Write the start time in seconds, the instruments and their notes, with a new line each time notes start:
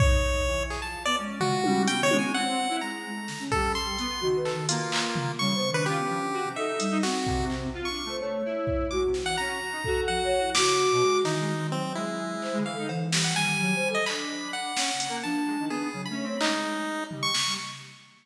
0.00 lead 1 (square) D#4 C#5, kick
0.47 lead 1 (square) E3
0.70 lead 1 (square) G#4, clap
0.82 lead 1 (square) F3 A5
1.05 lead 1 (square) B3 D5
1.18 ocarina G#3, lead 1 (square) C#4
1.40 lead 1 (square) F4 F#4, floor tom
1.64 lead 1 (square) G3, high tom
1.87 lead 1 (square) G3 G5, ocarina B3, closed hi-hat
2.01 lead 1 (square) D#3 C#5
2.11 lead 1 (square) G#3, high tom
2.19 lead 1 (square) G#5
2.34 lead 1 (square) C4 F#5
2.69 lead 1 (square) E4
2.81 lead 1 (square) G#3 A#5
3.06 ocarina G#3
3.15 lead 1 (square) A3
3.28 ocarina D3, snare
3.40 ocarina C#4
3.52 lead 1 (square) G3 A4, kick
3.75 lead 1 (square) C6
3.98 lead 1 (square) B3, closed hi-hat
4.21 lead 1 (square) D#3, ocarina F#4, floor tom
4.36 ocarina B4
4.45 lead 1 (square) A4, clap
4.53 ocarina D#3
4.69 lead 1 (square) A#3 F4, closed hi-hat
4.92 clap
5.16 floor tom
5.39 lead 1 (square) C#3 C#6, ocarina G3
5.55 lead 1 (square) B3, ocarina C5
5.70 ocarina D#3, lead 1 (square) D4
5.74 lead 1 (square) B4
5.86 ocarina C#4, lead 1 (square) F4 G4
5.98 lead 1 (square) B3
6.09 lead 1 (square) F3
6.22 lead 1 (square) D3
6.33 lead 1 (square) F#4
6.44 lead 1 (square) C3
6.55 lead 1 (square) D#4 E5, ocarina A4
6.79 ocarina G3, closed hi-hat
6.91 lead 1 (square) D#4
7.03 ocarina C4, lead 1 (square) F#4, snare
7.27 lead 1 (square) C3, kick
7.50 clap
7.75 lead 1 (square) F4
7.85 lead 1 (square) C#6
7.89 lead 1 (square) D4
8.05 lead 1 (square) A3, ocarina C5
8.19 lead 1 (square) A3, ocarina C#5
8.45 lead 1 (square) E4
8.67 kick
8.90 lead 1 (square) G#3 D6, ocarina F#4
9.06 lead 1 (square) C3
9.14 snare
9.22 lead 1 (square) E3 F#5
9.38 lead 1 (square) C#4 A#5
9.61 lead 1 (square) F#4
9.72 lead 1 (square) D#4
9.84 lead 1 (square) F#4, ocarina A4, kick
10.08 ocarina F3, lead 1 (square) F#5
10.24 ocarina C#5
10.39 ocarina E4
10.55 lead 1 (square) C#3 D6, ocarina F#4, snare
10.92 lead 1 (square) B2
11.01 lead 1 (square) G#3
11.24 ocarina D#3, lead 1 (square) E3 D#4, snare
11.40 lead 1 (square) G#3
11.57 lead 1 (square) C4
11.71 ocarina F#3, lead 1 (square) C4
11.95 lead 1 (square) G#3 E4
12.42 ocarina C5, clap
12.53 lead 1 (square) G#3
12.57 ocarina D3
12.65 lead 1 (square) E3 F5
12.73 ocarina A4
12.78 lead 1 (square) D#4
12.89 ocarina E3, cowbell
13.12 lead 1 (square) G3, snare
13.24 lead 1 (square) F#5
13.35 ocarina D#3, lead 1 (square) G3 G#5
13.60 ocarina F#3
13.75 ocarina C5
13.89 ocarina A4
13.95 lead 1 (square) D#5
14.06 lead 1 (square) D4 B5, clap
14.53 lead 1 (square) F#5
14.77 lead 1 (square) C#4, snare
14.94 lead 1 (square) C#3
15.00 closed hi-hat
15.09 lead 1 (square) A#3
15.23 lead 1 (square) F3 A5, ocarina D4
15.47 lead 1 (square) G#3
15.59 lead 1 (square) D#3
15.69 lead 1 (square) B3 G#4
15.93 lead 1 (square) C#3, ocarina F#3
16.05 ocarina A3, lead 1 (square) B5
16.11 lead 1 (square) C#4
16.23 lead 1 (square) C4, ocarina C#5
16.40 lead 1 (square) G#3 D#4, clap
17.11 lead 1 (square) G3, floor tom
17.23 lead 1 (square) C#6
17.34 snare
17.46 lead 1 (square) G3